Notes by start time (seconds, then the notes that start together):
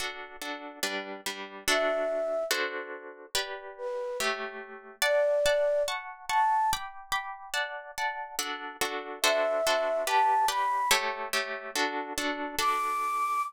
0.00 D4 F#4 A4
0.42 D4 F#4 A4
0.83 G3 D4 B4
1.26 G3 D4 B4
1.68 D4 F#4 A4 E5
2.51 D4 F#4 A4 C5
3.35 G4 B4 D5
3.78 B4
4.20 A3 G4 C#5 E5
5.02 D5 F#5 A5
5.46 D5 F#5 A5
5.88 F#5 A5 C#6
6.28 F#5 A5 C#6
6.73 G5 B5 D6
7.12 G5 B5 D6
7.54 D5 F#5 A5
7.98 D5 F#5 A5
8.39 D4 F#4 A4
8.81 D4 F#4 A4
9.22 D4 F#4 A4 C5 E5
9.67 D4 F#4 A4 C5
10.07 G4 B4 D5 A5
10.48 G4 B4 D5 B5
10.91 A3 G4 C#5 E5
11.33 A3 G4 C#5 E5
11.76 D4 F#4 A4
12.18 D4 F#4 A4
12.59 D4 F#4 A4 D6